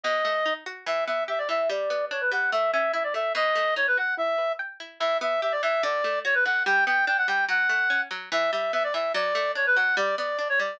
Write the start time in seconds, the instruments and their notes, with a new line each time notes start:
0.04 pizzicato strings B2, clarinet D#5
0.25 pizzicato strings A3
0.46 pizzicato strings D#4
0.66 pizzicato strings F#4
0.86 pizzicato strings E3, clarinet E5
1.07 pizzicato strings B3, clarinet E5
1.28 pizzicato strings G4, clarinet E5
1.38 clarinet D5
1.49 pizzicato strings E3, clarinet E5
1.69 pizzicato strings G3, clarinet D5
1.90 pizzicato strings B3
2.11 pizzicato strings D4, clarinet C#5
2.21 clarinet B4
2.32 pizzicato strings G3, clarinet F#5
2.52 pizzicato strings A3, clarinet E5
2.73 pizzicato strings C#4, clarinet E5
2.93 pizzicato strings E4, clarinet E5
3.04 clarinet D5
3.14 pizzicato strings A3, clarinet E5
3.35 pizzicato strings B2, clarinet D#5
3.55 pizzicato strings A3
3.76 pizzicato strings D#4, clarinet C#5
3.87 clarinet B4
3.97 pizzicato strings F#4, clarinet F#5
4.17 pizzicato strings E4, clarinet E5
4.38 pizzicato strings B4
4.59 pizzicato strings G5
4.80 pizzicato strings E4
5.00 pizzicato strings E3, clarinet E5
5.21 pizzicato strings B3, clarinet E5
5.42 pizzicato strings G4, clarinet E5
5.52 clarinet D5
5.63 pizzicato strings E3, clarinet E5
5.83 pizzicato strings D3, clarinet D5
6.04 pizzicato strings A3
6.25 pizzicato strings F#4, clarinet C#5
6.34 clarinet B4
6.45 pizzicato strings D3, clarinet F#5
6.66 pizzicato strings G3, clarinet G5
6.87 pizzicato strings B3, clarinet G5
7.07 pizzicato strings D4, clarinet G5
7.18 clarinet F#5
7.28 pizzicato strings G3, clarinet G5
7.49 pizzicato strings F#3, clarinet F#5
7.69 pizzicato strings A3
7.90 pizzicato strings C#4
8.11 pizzicato strings F#3
8.32 pizzicato strings E3, clarinet E5
8.52 pizzicato strings G3, clarinet E5
8.73 pizzicato strings B3, clarinet E5
8.84 clarinet D5
8.94 pizzicato strings E3, clarinet E5
9.14 pizzicato strings F#3, clarinet D5
9.35 pizzicato strings A3
9.55 pizzicato strings D4, clarinet C#5
9.66 clarinet B4
9.76 pizzicato strings F#3, clarinet F#5
9.97 pizzicato strings G3, clarinet D5
10.18 pizzicato strings B3, clarinet D5
10.38 pizzicato strings D4, clarinet D5
10.49 clarinet C#5
10.59 pizzicato strings G3, clarinet D5